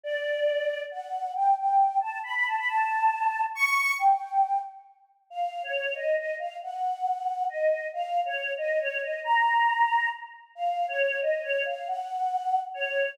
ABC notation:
X:1
M:3/4
L:1/16
Q:1/4=137
K:Bm
V:1 name="Choir Aahs"
d8 f4 | g2 g4 a2 b b a b | a8 c'4 | g6 z6 |
[K:Bbm] f3 d3 e2 e2 f2 | g8 e4 | f3 d3 e2 d2 e2 | b8 z4 |
f3 d3 e2 d2 f2 | g8 d4 |]